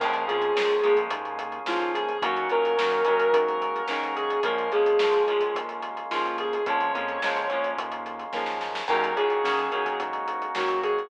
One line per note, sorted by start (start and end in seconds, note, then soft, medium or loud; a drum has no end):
0.00 0.24 A#1 medium
0.00 0.26 F3 medium
0.00 0.26 G#3 medium
0.00 2.18 A#3 medium
0.00 0.26 A#3 medium
0.00 0.26 C#4 medium
0.00 2.18 C#4 medium
0.00 2.18 F4 medium
0.00 2.18 G#4 loud
0.00 0.24 A#4 medium
0.00 kick loud
0.00 crash loud
0.13 closed hi-hat medium
0.27 0.50 F2 medium
0.27 0.53 F3 medium
0.27 0.53 G#3 medium
0.27 0.53 A#3 medium
0.27 0.53 C#4 medium
0.27 0.98 G#4 medium
0.27 closed hi-hat medium
0.42 closed hi-hat medium
0.55 0.79 C#2 medium
0.55 0.81 F3 medium
0.55 0.81 G#3 medium
0.55 0.81 A#3 medium
0.55 0.81 C#4 medium
0.55 snare loud
0.70 closed hi-hat medium
0.83 1.08 A#1 medium
0.83 1.60 F3 medium
0.83 1.60 G#3 medium
0.83 1.60 A#3 medium
0.83 1.60 C#4 medium
0.83 closed hi-hat medium
0.96 kick medium
0.96 closed hi-hat medium
1.11 1.59 D#2 medium
1.11 kick medium
1.11 closed hi-hat loud
1.25 closed hi-hat medium
1.39 closed hi-hat medium
1.52 closed hi-hat medium
1.66 2.13 D#2 medium
1.66 2.18 G#3 medium
1.66 2.18 A#3 medium
1.66 2.18 C#4 medium
1.66 1.91 F4 medium
1.66 snare loud
1.70 2.18 F3 medium
1.80 closed hi-hat medium
1.94 2.20 G#4 medium
1.94 closed hi-hat medium
2.09 closed hi-hat medium
2.22 2.45 D#2 medium
2.22 2.48 D#3 medium
2.22 2.48 F#3 medium
2.22 4.40 A#3 loud
2.22 2.48 A#3 medium
2.22 2.48 C#4 medium
2.22 4.40 C#4 loud
2.22 4.40 D#4 medium
2.22 4.40 F#4 medium
2.22 2.47 F#4 medium
2.22 kick medium
2.22 closed hi-hat loud
2.36 closed hi-hat medium
2.49 2.74 A#2 medium
2.49 2.76 D#3 medium
2.49 2.76 F#3 medium
2.49 2.76 A#3 medium
2.49 2.76 C#4 medium
2.49 3.31 A#4 medium
2.49 closed hi-hat medium
2.65 closed hi-hat medium
2.77 3.01 F#2 medium
2.77 3.03 D#3 medium
2.77 3.03 F#3 medium
2.77 3.03 A#3 medium
2.77 3.03 C#4 medium
2.77 snare loud
2.91 closed hi-hat medium
3.05 3.30 D#2 medium
3.05 3.82 D#3 medium
3.05 3.82 F#3 medium
3.05 3.82 A#3 medium
3.05 3.82 C#4 medium
3.05 closed hi-hat medium
3.19 closed hi-hat medium
3.33 3.80 G#2 medium
3.33 3.86 A#4 medium
3.33 kick medium
3.33 closed hi-hat loud
3.48 closed hi-hat medium
3.62 closed hi-hat medium
3.76 closed hi-hat medium
3.88 4.37 G#2 medium
3.88 4.40 F#3 medium
3.88 4.40 A#3 medium
3.88 4.40 C#4 medium
3.88 4.13 A#4 medium
3.88 snare medium
3.92 4.40 D#3 medium
4.03 closed hi-hat medium
4.16 4.42 G#4 medium
4.16 closed hi-hat medium
4.30 closed hi-hat medium
4.43 4.68 A#1 medium
4.43 6.62 G#3 loud
4.43 4.70 G#3 medium
4.43 6.62 A#3 medium
4.43 4.70 A#3 medium
4.43 4.70 C#4 medium
4.43 6.62 C#4 medium
4.43 6.62 F4 loud
4.43 4.71 A#4 medium
4.43 kick medium
4.43 closed hi-hat loud
4.47 4.70 F3 medium
4.58 closed hi-hat medium
4.72 4.96 F2 medium
4.72 4.98 F3 medium
4.72 4.98 G#3 medium
4.72 4.98 A#3 medium
4.72 4.98 C#4 medium
4.72 5.53 G#4 medium
4.72 closed hi-hat medium
4.86 closed hi-hat medium
4.99 5.23 C#2 medium
4.99 5.26 F3 medium
4.99 5.26 G#3 medium
4.99 5.26 A#3 medium
4.99 5.26 C#4 medium
4.99 snare loud
5.13 closed hi-hat medium
5.27 5.51 A#1 medium
5.27 6.04 F3 medium
5.27 6.04 G#3 medium
5.27 6.04 A#3 medium
5.27 6.04 C#4 medium
5.27 closed hi-hat medium
5.40 kick medium
5.40 closed hi-hat medium
5.55 6.02 D#2 medium
5.55 kick medium
5.55 closed hi-hat medium
5.69 closed hi-hat medium
5.82 closed hi-hat medium
5.97 closed hi-hat medium
6.11 6.58 D#2 medium
6.11 6.62 F3 medium
6.11 6.62 G#3 medium
6.11 6.62 A#3 medium
6.11 6.62 C#4 medium
6.11 6.34 F4 medium
6.11 snare medium
6.25 closed hi-hat medium
6.38 6.63 G#4 medium
6.38 closed hi-hat medium
6.53 closed hi-hat medium
6.66 6.91 A#1 medium
6.66 6.92 F3 medium
6.66 8.84 G#3 medium
6.66 6.92 G#3 medium
6.66 8.84 A#3 medium
6.66 6.92 A#3 medium
6.66 6.92 C#4 medium
6.66 8.84 C#4 medium
6.66 8.84 F4 loud
6.66 7.66 C#5 medium
6.66 kick loud
6.66 closed hi-hat medium
6.81 closed hi-hat medium
6.94 7.18 F2 medium
6.94 7.20 F3 medium
6.94 7.20 G#3 medium
6.94 7.20 A#3 medium
6.94 7.20 C#4 medium
6.94 closed hi-hat medium
7.08 closed hi-hat medium
7.22 7.47 C#2 medium
7.22 7.48 F3 medium
7.22 7.48 G#3 medium
7.22 7.48 A#3 medium
7.22 7.48 C#4 medium
7.22 snare loud
7.37 closed hi-hat medium
7.50 7.74 A#1 medium
7.50 8.27 F3 medium
7.50 8.27 G#3 medium
7.50 8.27 A#3 medium
7.50 8.27 C#4 medium
7.50 closed hi-hat medium
7.64 closed hi-hat medium
7.77 8.25 D#2 medium
7.77 kick medium
7.77 closed hi-hat loud
7.92 closed hi-hat medium
8.06 closed hi-hat medium
8.19 closed hi-hat medium
8.33 8.81 D#2 medium
8.33 8.84 F3 medium
8.33 8.84 G#3 medium
8.33 8.84 A#3 medium
8.33 8.84 C#4 medium
8.33 kick medium
8.33 snare medium
8.46 snare medium
8.61 snare medium
8.75 snare loud
8.88 9.12 D#2 medium
8.88 9.14 D#3 medium
8.88 9.14 F#3 medium
8.88 11.07 A#3 loud
8.88 9.14 A#3 medium
8.88 9.14 C#4 medium
8.88 11.07 C#4 medium
8.88 11.07 D#4 medium
8.88 11.07 F#4 loud
8.88 9.16 A#4 medium
8.88 kick medium
8.88 crash loud
9.04 closed hi-hat medium
9.16 9.40 A#2 medium
9.16 9.42 D#3 medium
9.16 9.42 F#3 medium
9.16 9.42 A#3 medium
9.16 9.42 C#4 medium
9.16 9.96 G#4 medium
9.16 closed hi-hat medium
9.30 closed hi-hat medium
9.44 9.67 F#2 medium
9.44 9.70 D#3 medium
9.44 9.70 F#3 medium
9.44 9.70 A#3 medium
9.44 9.70 C#4 medium
9.44 snare medium
9.59 closed hi-hat medium
9.72 9.95 D#2 medium
9.72 10.49 D#3 medium
9.72 10.49 F#3 medium
9.72 10.49 A#3 medium
9.72 10.49 C#4 medium
9.72 closed hi-hat medium
9.86 kick medium
9.86 closed hi-hat medium
10.00 10.48 G#2 medium
10.00 kick medium
10.00 closed hi-hat medium
10.13 closed hi-hat medium
10.28 closed hi-hat medium
10.42 closed hi-hat medium
10.55 11.03 G#2 medium
10.55 11.07 D#3 medium
10.55 11.07 F#3 medium
10.55 11.07 A#3 medium
10.55 11.07 C#4 medium
10.55 10.78 F#4 medium
10.55 snare loud
10.68 closed hi-hat medium
10.83 11.09 G#4 medium
10.83 closed hi-hat medium
10.98 closed hi-hat medium